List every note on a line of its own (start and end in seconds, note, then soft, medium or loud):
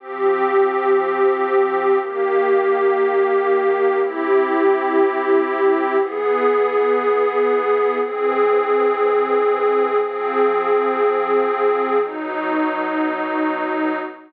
0.00 1.98 F3 loud
0.00 1.98 C4 loud
0.00 1.98 G4 loud
2.01 3.99 D#3 loud
2.01 3.99 A#3 loud
2.01 3.98 G4 loud
3.99 5.97 C4 medium
3.99 5.97 E4 loud
3.99 5.97 G4 loud
6.00 7.98 E3 loud
6.00 7.98 B3 loud
6.00 7.98 G#4 loud
8.00 9.98 E3 loud
8.00 9.98 C4 loud
8.00 9.98 G#4 loud
10.00 11.98 F3 loud
10.00 11.98 C4 loud
10.00 11.98 G#4 medium
12.01 13.99 B2 loud
12.01 13.99 F#3 loud
12.01 13.99 D#4 loud